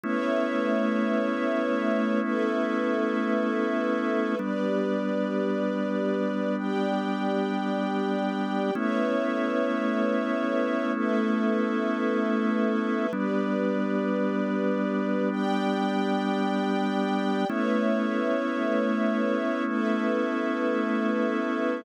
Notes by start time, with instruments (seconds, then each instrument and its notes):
0.03 drawbar organ A3 B3 C#4 E4, string ensemble 1 A3 B4 C#5 E5
2.22 string ensemble 1 A3 A4 B4 E5
4.39 drawbar organ G3 B3 D4, string ensemble 1 G4 B4 D5
6.58 string ensemble 1 G4 D5 G5
8.75 drawbar organ A3 B3 C#4 E4, string ensemble 1 A3 B4 C#5 E5
10.95 string ensemble 1 A3 A4 B4 E5
13.13 drawbar organ G3 B3 D4, string ensemble 1 G4 B4 D5
15.31 string ensemble 1 G4 D5 G5
17.48 string ensemble 1 A3 B4 C#5 E5, drawbar organ A3 B3 C#4 E4
19.67 string ensemble 1 A3 A4 B4 E5